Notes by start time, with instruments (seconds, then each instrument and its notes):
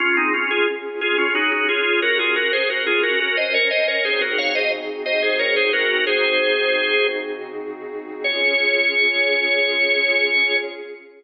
0.00 drawbar organ C#4 F4, pad 5 (bowed) C#4 F4 G#4
0.17 drawbar organ C4 D#4
0.34 drawbar organ C#4 F4
0.51 drawbar organ F4 G#4
1.01 pad 5 (bowed) C#4 G#4 C#5, drawbar organ F4 G#4
1.18 drawbar organ C#4 F4
1.35 drawbar organ D#4 F#4
1.52 drawbar organ D#4 F#4
1.69 drawbar organ F4 G#4
2.02 pad 5 (bowed) C#4 F#4 A#4, drawbar organ F#4 A#4
2.19 drawbar organ F4 G#4
2.36 drawbar organ F#4 A#4
2.53 drawbar organ G#4 C5
2.70 drawbar organ F#4 A#4
2.87 drawbar organ F4 G#4
3.03 pad 5 (bowed) C#4 A#4 C#5, drawbar organ F#4 A#4
3.20 drawbar organ F#4 A#4
3.37 drawbar organ C5 D#5
3.54 drawbar organ A#4 C#5
3.71 drawbar organ C5 D#5
3.88 drawbar organ A#4 C#5
4.04 pad 5 (bowed) C#3 C4 D#4 F#4 G#4, drawbar organ G#4 C5
4.21 drawbar organ F#4 A#4
4.38 drawbar organ C#5 F5
4.55 drawbar organ C5 D#5
5.06 drawbar organ C5 D#5
5.22 drawbar organ G#4 C5
5.39 drawbar organ A#4 C#5
5.56 drawbar organ G#4 C5
5.73 drawbar organ F#4 A#4
6.07 pad 5 (bowed) C#3 C4 D#4 F#4 G#4, drawbar organ G#4 C5
8.24 pad 5 (bowed) C#4 F4 G#4, drawbar organ C#5